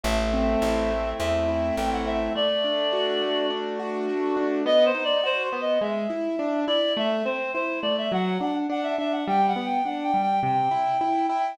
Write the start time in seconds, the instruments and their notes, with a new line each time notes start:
0.03 electric bass (finger) A1, acoustic grand piano A3, clarinet E5
0.34 acoustic grand piano C4
0.62 electric bass (finger) A1, acoustic grand piano E4
0.91 acoustic grand piano A3
1.19 electric bass (finger) E2, acoustic grand piano C4, clarinet E5
1.48 acoustic grand piano E4
1.76 electric bass (finger) A1, acoustic grand piano A3, clarinet G5
1.92 clarinet F#5
2.06 acoustic grand piano C4, clarinet E5
2.35 acoustic grand piano A3, clarinet D5
2.64 acoustic grand piano D4
2.93 acoustic grand piano F#4
3.22 acoustic grand piano A3
3.50 acoustic grand piano D4
3.79 acoustic grand piano F#4
4.09 acoustic grand piano A3
4.37 acoustic grand piano D4
4.66 acoustic grand piano B3, clarinet D#5
4.86 clarinet C5
4.95 acoustic grand piano D#4
5.04 clarinet D5
5.23 acoustic grand piano F#4, clarinet C5
5.43 clarinet C5
5.53 acoustic grand piano B3
5.61 clarinet D#5
5.81 acoustic grand piano G#3, clarinet E5
6.10 acoustic grand piano E4
6.39 acoustic grand piano D4
6.68 acoustic grand piano E4, clarinet D5
6.97 acoustic grand piano A3, clarinet E5
7.25 acoustic grand piano C4, clarinet C5
7.54 acoustic grand piano E4, clarinet C5
7.82 acoustic grand piano A3, clarinet D5
7.98 clarinet E5
8.12 acoustic grand piano F#3, clarinet F#5
8.41 acoustic grand piano D4, clarinet F#5
8.69 acoustic grand piano D4, clarinet F#5
8.83 clarinet E5
8.98 acoustic grand piano D4, clarinet E5
9.12 clarinet F#5
9.28 acoustic grand piano G3, clarinet G5
9.48 clarinet F#5
9.56 acoustic grand piano B3
9.66 clarinet G5
9.85 acoustic grand piano D4, clarinet F#5
10.04 clarinet G5
10.14 acoustic grand piano G3
10.22 clarinet G5
10.43 acoustic grand piano C3, clarinet G5
10.71 acoustic grand piano E4
11.01 acoustic grand piano E4
11.29 acoustic grand piano E4, clarinet G5